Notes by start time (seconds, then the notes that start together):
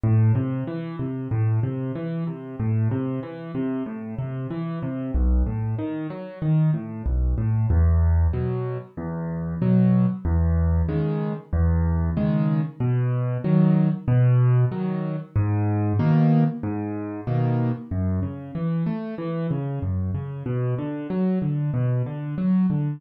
0.03 A2
0.35 C3
0.67 E3
0.99 C3
1.31 A2
1.63 C3
1.95 E3
2.27 C3
2.60 A2
2.91 C3
3.23 E3
3.55 C3
3.86 A2
4.18 C3
4.51 E3
4.83 C3
5.14 B1
5.46 A2
5.79 D#3
6.10 F#3
6.42 D#3
6.74 A2
7.06 B1
7.38 A2
7.70 E2
8.33 B2 F#3
8.97 E2
9.62 B2 F#3
10.25 E2
10.89 C#3 D#3 G#3
11.53 E2
12.17 C#3 D#3 G#3
12.80 B2
13.44 D#3 F#3
14.08 B2
14.72 D#3 F#3
15.36 G#2
15.99 B2 D#3 A#3
16.63 G#2
17.27 B2 D#3 A#3
17.91 F#2
18.23 C#3
18.55 E3
18.86 A3
19.18 E3
19.51 C#3
19.82 F#2
20.14 C#3
20.46 B2
20.78 D3
21.10 F#3
21.42 D3
21.74 B2
22.06 D3
22.38 F#3
22.70 D3